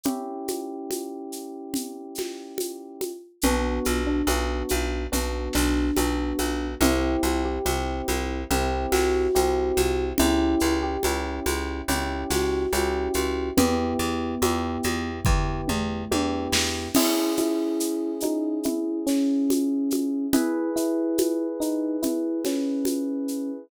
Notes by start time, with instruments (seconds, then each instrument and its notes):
0.04 electric piano 1 C#4 E4 G4, low conga, shaker
0.48 high conga, shaker
0.91 high conga, shaker
1.32 shaker
1.74 low conga, shaker
2.15 snare, high conga, shaker
2.58 high conga, shaker
3.01 high conga, shaker
3.42 electric bass (finger) B1, electric piano 1 B3 D4 F#4, low conga, shaker
3.85 electric bass (finger) B1, high conga, shaker
4.07 electric piano 1 D4
4.27 electric bass (finger) B1, electric piano 1 B3 D4 F#4, high conga, shaker
4.69 electric bass (finger) B1, high conga, shaker
5.12 electric bass (finger) B1, electric piano 1 B3 D4 F#4, low conga, shaker
5.53 electric bass (finger) B1, electric piano 1 D4, snare, shaker
5.96 electric bass (finger) B1, electric piano 1 B3 D4 F#4, high conga, shaker
6.39 electric bass (finger) B1, high conga, shaker
6.81 electric bass (finger) C2, electric piano 1 C4 E4 G4, low conga, shaker
7.23 electric bass (finger) C2, high conga, shaker
7.45 electric piano 1 G4
7.65 electric bass (finger) C2, electric piano 1 C4 E4 G4, high conga, shaker
8.08 electric bass (finger) C2, high conga, shaker
8.51 electric bass (finger) C2, electric piano 1 C4 E4 G4, low conga, shaker
8.92 electric bass (finger) C2, electric piano 1 F#4, snare, high conga, shaker
9.35 electric bass (finger) C2, electric piano 1 C4 E4 G4, high conga, shaker
9.77 electric bass (finger) C2, high conga, shaker
10.18 electric bass (finger) C#2, electric piano 1 C#4 E4 G4, low conga, shaker
10.60 electric bass (finger) C#2, shaker
10.83 electric piano 1 G4
11.03 electric bass (finger) C#2, electric piano 1 C#4 E4 G4, high conga, shaker
11.46 electric bass (finger) C#2, high conga, shaker
11.88 electric bass (finger) C#2, electric piano 1 C#4 E4 G4, low conga, shaker
12.30 electric bass (finger) C#2, electric piano 1 F#4, snare, high conga, shaker
12.73 electric bass (finger) C#2, electric piano 1 C#4 E4 G4, high conga, shaker
13.14 electric bass (finger) C#2, high conga, shaker
13.57 electric bass (finger) E2, electric piano 1 B3 E4 G4, low conga, shaker
13.99 electric bass (finger) E2, shaker
14.42 electric bass (finger) E2, electric piano 1 B3 E4 G4, high conga, shaker
14.83 electric bass (finger) E2, high conga, shaker
15.25 electric bass (finger) E2, electric piano 1 B3 E4 G4, kick, floor tom
15.68 electric bass (finger) E2, mid tom
16.11 electric bass (finger) E2, electric piano 1 B3 E4 G4, high tom
16.52 electric bass (finger) E2, snare
16.94 electric piano 1 C#4 E4 G#4, crash, low conga, shaker
17.37 electric piano 1 E4, high conga, shaker
17.80 shaker
18.20 electric piano 1 D#4, high conga, shaker
18.63 electric piano 1 E4, low conga, shaker
19.07 electric piano 1 C#4, snare, shaker
19.50 high conga, shaker
19.90 high conga, shaker
20.33 electric piano 1 E4 G#4 B4, low conga, shaker
20.76 electric piano 1 E4, shaker
21.18 high conga, shaker
21.60 electric piano 1 D#4, shaker
22.02 electric piano 1 E4, low conga, shaker
22.45 electric piano 1 C#4, snare, high conga, shaker
22.85 high conga, shaker
23.28 shaker